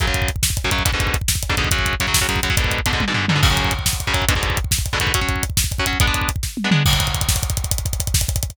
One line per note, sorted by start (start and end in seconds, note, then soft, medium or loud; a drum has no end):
0.00 0.06 F#2 medium
0.00 0.06 C#3 medium
0.00 0.06 F#3 medium
0.00 kick loud
0.00 closed hi-hat loud
0.07 0.30 F#2 medium
0.07 0.30 C#3 medium
0.07 0.30 F#3 medium
0.07 kick medium
0.14 kick medium
0.14 closed hi-hat medium
0.22 kick medium
0.28 kick medium
0.28 closed hi-hat medium
0.36 kick medium
0.43 kick medium
0.43 snare loud
0.50 kick medium
0.57 kick medium
0.57 closed hi-hat medium
0.64 0.70 F#2 medium
0.64 0.70 C#3 medium
0.64 0.70 F#3 medium
0.64 kick medium
0.71 0.83 F#2 medium
0.71 0.83 C#3 medium
0.71 0.83 F#3 medium
0.71 kick medium
0.71 closed hi-hat medium
0.79 kick medium
0.85 0.91 G#2 medium
0.85 0.91 B2 medium
0.85 0.91 D3 medium
0.85 kick loud
0.85 closed hi-hat loud
0.92 1.16 G#2 medium
0.92 1.16 B2 medium
0.92 1.16 D3 medium
0.92 kick medium
1.00 kick medium
1.00 closed hi-hat medium
1.07 kick medium
1.14 kick medium
1.14 closed hi-hat medium
1.21 kick medium
1.28 kick medium
1.28 snare loud
1.35 kick medium
1.42 kick medium
1.42 closed hi-hat medium
1.49 1.55 G#2 medium
1.49 1.55 B2 medium
1.49 1.55 D3 medium
1.49 kick medium
1.57 1.69 G#2 medium
1.57 1.69 B2 medium
1.57 1.69 D3 medium
1.57 kick medium
1.57 closed hi-hat medium
1.64 kick medium
1.71 1.95 F#2 medium
1.71 1.95 C#3 medium
1.71 1.95 F#3 medium
1.71 kick loud
1.71 closed hi-hat loud
1.79 kick medium
1.86 kick medium
1.86 closed hi-hat medium
1.93 kick medium
2.00 2.06 F#2 medium
2.00 2.06 C#3 medium
2.00 2.06 F#3 medium
2.00 kick medium
2.00 closed hi-hat medium
2.07 2.19 F#2 medium
2.07 2.19 C#3 medium
2.07 2.19 F#3 medium
2.07 kick medium
2.14 kick medium
2.14 snare loud
2.21 2.27 F#2 medium
2.21 2.27 C#3 medium
2.21 2.27 F#3 medium
2.21 kick medium
2.29 2.40 F#2 medium
2.29 2.40 C#3 medium
2.29 2.40 F#3 medium
2.29 kick medium
2.29 closed hi-hat medium
2.36 kick medium
2.43 2.49 F#2 medium
2.43 2.49 C#3 medium
2.43 2.49 F#3 medium
2.43 kick medium
2.43 closed hi-hat medium
2.50 2.56 F#2 medium
2.50 2.56 C#3 medium
2.50 2.56 F#3 medium
2.50 kick medium
2.57 2.80 G#2 medium
2.57 2.80 B2 medium
2.57 2.80 D3 medium
2.57 kick loud
2.57 closed hi-hat loud
2.64 kick medium
2.71 kick medium
2.71 closed hi-hat medium
2.78 kick medium
2.86 2.92 G#2 medium
2.86 2.92 B2 medium
2.86 2.92 D3 medium
2.86 kick medium
2.86 closed hi-hat medium
2.93 3.05 G#2 medium
2.93 3.05 B2 medium
2.93 3.05 D3 medium
2.93 kick medium
3.00 kick medium
3.00 high tom medium
3.08 3.13 G#2 medium
3.08 3.13 B2 medium
3.08 3.13 D3 medium
3.14 3.26 G#2 medium
3.14 3.26 B2 medium
3.14 3.26 D3 medium
3.14 floor tom medium
3.28 3.35 G#2 medium
3.28 3.35 B2 medium
3.28 3.35 D3 medium
3.28 mid tom loud
3.35 3.41 G#2 medium
3.35 3.41 B2 medium
3.35 3.41 D3 medium
3.42 3.48 F#2 medium
3.42 3.48 C#3 loud
3.42 3.48 F#3 medium
3.42 kick loud
3.42 crash loud
3.50 3.73 F#2 medium
3.50 3.73 C#3 medium
3.50 3.73 F#3 medium
3.50 kick medium
3.57 kick medium
3.57 closed hi-hat medium
3.64 kick medium
3.71 kick medium
3.71 closed hi-hat medium
3.79 kick medium
3.86 kick medium
3.86 snare loud
3.93 kick medium
4.00 kick medium
4.00 closed hi-hat medium
4.07 4.13 F#2 medium
4.07 4.13 C#3 medium
4.07 4.13 F#3 medium
4.07 kick medium
4.13 4.25 F#2 medium
4.13 4.25 C#3 medium
4.13 4.25 F#3 medium
4.13 kick medium
4.13 closed hi-hat medium
4.22 kick medium
4.29 4.34 G#2 medium
4.29 4.34 B2 medium
4.29 4.34 D3 medium
4.29 kick loud
4.29 closed hi-hat loud
4.35 4.59 G#2 medium
4.35 4.59 B2 medium
4.35 4.59 D3 medium
4.35 kick medium
4.43 kick medium
4.43 closed hi-hat medium
4.50 kick medium
4.57 kick medium
4.57 closed hi-hat medium
4.64 kick medium
4.71 kick medium
4.71 snare loud
4.79 kick medium
4.86 kick medium
4.86 closed hi-hat medium
4.93 4.99 G#2 medium
4.93 4.99 B2 medium
4.93 4.99 D3 medium
4.93 kick medium
5.00 5.12 G#2 medium
5.00 5.12 B2 medium
5.00 5.12 D3 medium
5.00 kick medium
5.00 closed hi-hat medium
5.07 kick medium
5.14 5.20 F#3 medium
5.14 5.20 C#4 medium
5.14 5.20 F#4 medium
5.14 kick medium
5.14 closed hi-hat loud
5.21 5.44 F#3 medium
5.21 5.44 C#4 medium
5.21 5.44 F#4 medium
5.21 kick medium
5.29 kick medium
5.29 closed hi-hat medium
5.36 kick medium
5.43 kick medium
5.43 closed hi-hat medium
5.50 kick medium
5.57 kick medium
5.57 snare loud
5.64 kick medium
5.71 kick medium
5.71 closed hi-hat medium
5.78 5.85 F#3 medium
5.78 5.85 C#4 medium
5.78 5.85 F#4 medium
5.78 kick medium
5.86 5.98 F#3 medium
5.86 5.98 C#4 medium
5.86 5.98 F#4 medium
5.86 kick medium
5.86 closed hi-hat medium
5.93 kick medium
6.00 6.06 G#3 medium
6.00 6.06 B3 medium
6.00 6.06 D4 medium
6.00 kick loud
6.00 closed hi-hat medium
6.07 6.30 G#3 medium
6.07 6.30 B3 medium
6.07 6.30 D4 medium
6.07 kick medium
6.14 kick medium
6.14 closed hi-hat medium
6.21 kick medium
6.28 kick medium
6.28 closed hi-hat medium
6.36 kick medium
6.43 kick medium
6.43 snare medium
6.57 high tom medium
6.64 6.70 G#3 medium
6.64 6.70 B3 medium
6.64 6.70 D4 medium
6.71 6.83 G#3 medium
6.71 6.83 B3 medium
6.71 6.83 D4 medium
6.71 mid tom loud
6.86 kick loud
6.86 crash loud
6.93 kick medium
6.93 closed hi-hat medium
7.00 kick medium
7.00 closed hi-hat medium
7.07 kick medium
7.07 closed hi-hat medium
7.14 kick medium
7.14 closed hi-hat medium
7.21 kick medium
7.21 closed hi-hat medium
7.29 kick loud
7.29 snare loud
7.36 kick medium
7.36 closed hi-hat medium
7.43 kick medium
7.43 closed hi-hat medium
7.50 kick medium
7.50 closed hi-hat medium
7.57 kick medium
7.57 closed hi-hat medium
7.64 kick medium
7.64 closed hi-hat medium
7.71 kick loud
7.71 closed hi-hat loud
7.78 kick medium
7.78 closed hi-hat medium
7.85 kick medium
7.85 closed hi-hat medium
7.93 kick medium
7.93 closed hi-hat medium
8.00 kick medium
8.00 closed hi-hat medium
8.07 kick medium
8.07 closed hi-hat medium
8.14 kick loud
8.14 snare loud
8.21 kick medium
8.21 closed hi-hat medium
8.28 kick medium
8.28 closed hi-hat medium
8.36 kick medium
8.36 closed hi-hat medium
8.43 kick medium
8.43 closed hi-hat medium
8.50 kick medium
8.50 closed hi-hat medium